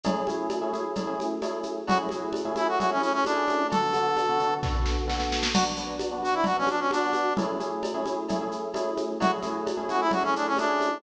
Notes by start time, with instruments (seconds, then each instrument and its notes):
0.04 electric piano 1 A3 C#4 E4 G#4, cowbell, low conga, shaker
0.27 electric piano 1 A3 C#4 E4 G#4, high conga, shaker
0.50 cowbell, high conga, shaker
0.61 electric piano 1 A3 C#4 E4 G#4
0.73 electric piano 1 A3 C#4 E4 G#4, high conga, shaker
0.95 electric piano 1 A3 C#4 E4 G#4, cowbell, low conga, shaker
1.07 electric piano 1 A3 C#4 E4 G#4
1.20 high conga, shaker
1.42 electric piano 1 A3 C#4 E4 G#4, cowbell, high conga, shaker
1.63 high conga, shaker
1.87 electric piano 1 A3 C#4 E4 G#4, brass section F#4, cowbell, low conga, shaker
2.09 electric piano 1 A3 C#4 E4 G#4, high conga, shaker
2.33 cowbell, high conga, shaker
2.45 electric piano 1 A3 C#4 E4 G#4
2.56 electric piano 1 A3 C#4 E4 G#4, brass section E4, high conga, shaker
2.68 brass section F#4
2.79 electric piano 1 A3 C#4 E4 G#4, brass section F#4, cowbell, low conga, shaker
2.90 electric piano 1 A3 C#4 E4 G#4, brass section C#4
3.00 brass section C#4, high conga, shaker
3.13 brass section C#4
3.25 electric piano 1 A3 C#4 E4 G#4, brass section D4, cowbell, high conga, shaker
3.48 high conga, shaker
3.70 electric piano 1 D3 B3 F#4 A4, brass section A4, cowbell, low conga, shaker
3.93 electric piano 1 D3 B3 F#4 A4, high conga, shaker
4.17 cowbell, high conga, shaker
4.29 electric piano 1 D3 B3 F#4 A4
4.39 electric piano 1 D3 B3 F#4 A4, shaker
4.63 electric piano 1 D3 B3 F#4 A4, kick, snare
4.75 electric piano 1 D3 B3 F#4 A4
4.86 snare
5.08 electric piano 1 D3 B3 F#4 A4, snare
5.20 snare
5.32 snare
5.43 snare
5.54 electric piano 1 B3 D4 F#4, brass section F#4, crash, cowbell, low conga, shaker
5.76 electric piano 1 B3 D4 F#4, shaker
5.99 cowbell, high conga, shaker
6.11 electric piano 1 B3 D4 F#4
6.23 electric piano 1 B3 D4 F#4, brass section F#4, shaker
6.34 brass section E4
6.44 electric piano 1 B3 D4 F#4, brass section F#4, cowbell, low conga, shaker
6.57 electric piano 1 B3 D4 F#4, brass section C#4
6.67 brass section D4, high conga, shaker
6.80 brass section C#4
6.91 electric piano 1 B3 D4 F#4, brass section D4, cowbell, high conga, shaker
7.13 high conga, shaker
7.37 electric piano 1 A3 C#4 E4 G#4, cowbell, low conga, shaker
7.60 electric piano 1 A3 C#4 E4 G#4, high conga, shaker
7.83 cowbell, high conga, shaker
7.94 electric piano 1 A3 C#4 E4 G#4
8.06 electric piano 1 A3 C#4 E4 G#4, high conga, shaker
8.29 electric piano 1 A3 C#4 E4 G#4, cowbell, low conga, shaker
8.41 electric piano 1 A3 C#4 E4 G#4
8.52 shaker
8.74 electric piano 1 A3 C#4 E4 G#4, cowbell, high conga, shaker
8.97 high conga, shaker
9.20 electric piano 1 A3 C#4 E4 G#4, brass section F#4, cowbell, low conga, shaker
9.42 electric piano 1 A3 C#4 E4 G#4, high conga, shaker
9.67 cowbell, high conga, shaker
9.77 electric piano 1 A3 C#4 E4 G#4
9.89 electric piano 1 A3 C#4 E4 G#4, brass section F#4, high conga, shaker
10.01 brass section E4
10.11 electric piano 1 A3 C#4 E4 G#4, brass section F#4, cowbell, low conga, shaker
10.23 electric piano 1 A3 C#4 E4 G#4, brass section C#4
10.36 brass section D4, shaker
10.47 brass section C#4
10.57 electric piano 1 A3 C#4 E4 G#4, brass section D4, cowbell, high conga, shaker
10.81 high conga, shaker